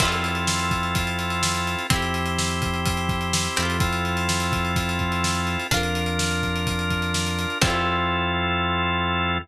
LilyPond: <<
  \new Staff \with { instrumentName = "Drawbar Organ" } { \time 4/4 \key f \major \tempo 4 = 126 <c' e' f' a'>1 | <c' e' g'>1 | <c' e' f' a'>1 | <d' f' bes'>1 |
<c' e' f' a'>1 | }
  \new Staff \with { instrumentName = "Acoustic Guitar (steel)" } { \time 4/4 \key f \major <c' e' f' a'>1 | <c' e' g'>2.~ <c' e' g'>8 <c' e' f' a'>8~ | <c' e' f' a'>1 | <d' f' bes'>1 |
<c' e' f' a'>1 | }
  \new Staff \with { instrumentName = "Synth Bass 1" } { \clef bass \time 4/4 \key f \major f,1 | f,2.~ f,8 f,8~ | f,1 | f,1 |
f,1 | }
  \new DrumStaff \with { instrumentName = "Drums" } \drummode { \time 4/4 <cymc bd>16 hh16 hh16 hh16 sn16 hh16 <hh bd>16 hh16 <hh bd>16 hh16 hh16 hh16 sn16 hh16 hh16 hh16 | <hh bd>16 hh16 hh16 hh16 sn16 hh16 <hh bd>16 hh16 <hh bd>16 hh16 <hh bd>16 hh16 sn16 hh16 hh16 hh16 | <hh bd>16 hh16 hh16 hh16 sn16 hh16 <hh bd>16 hh16 <hh bd>16 hh16 <hh bd>16 hh16 sn16 hh16 hh16 hh16 | <hh bd>16 hh16 hh16 hh16 sn16 hh16 <hh bd>16 hh16 <hh bd>16 hh16 <hh bd>16 hh16 sn16 hh16 hh16 hh16 |
<cymc bd>4 r4 r4 r4 | }
>>